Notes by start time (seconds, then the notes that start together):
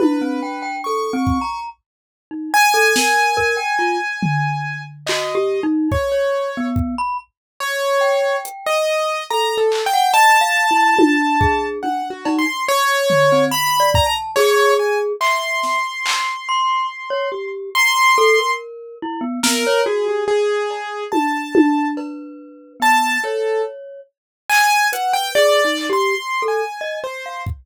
0.00 E4 B4, high tom
0.21 C4
0.43 G5
0.62 G5
0.84 A4 C#6
1.13 C4
1.27 kick
1.41 A#5
2.31 D#4
2.54 G#5
2.74 A4
2.96 A#4, snare
3.37 A#4, kick
3.57 G5
3.79 F4
4.23 floor tom
5.07 F#4 D#5, clap
5.35 G4
5.63 D#4
5.92 C#5, kick
6.12 C#5
6.57 B3
6.76 kick
6.98 B5
7.60 C#5
8.01 G5
8.45 closed hi-hat
8.66 D#5
9.30 A4 A#5
9.58 A4
9.72 clap
9.86 G5
9.93 F#5
10.14 D#5 A5
10.41 F5
10.71 E4
10.96 F4, high tom
11.40 G#4, kick
11.83 D4 F#5, high tom
12.10 F#4
12.25 D#4, cowbell
12.39 C6
12.68 C#5
13.10 floor tom
13.32 C4
13.51 B5
13.80 D5
13.94 A#5, kick
14.06 A5
14.36 G#4 C#5, clap
14.79 G#5
15.21 E5 C6, clap
15.63 snare
16.06 clap
16.49 C6
17.10 C#5
17.32 G4
17.75 A#5 C6
18.18 A4
18.38 A#4
19.02 E4
19.21 B3
19.43 B3 A#4, snare
19.67 C#5
19.86 F#4 G#4
20.08 G4
20.28 G#4
20.70 cowbell
21.12 A5, high tom
21.55 high tom
21.97 B4, cowbell
22.80 B3 A5, cowbell
23.24 A4 C#5
24.49 G#5, clap
24.93 B4 F#5, closed hi-hat
25.13 G5
25.35 G#4 D5
25.65 D#4
25.77 clap
25.90 G4 C6
26.42 A4
26.48 G#5
26.81 D#5
27.04 C5
27.26 F5
27.46 kick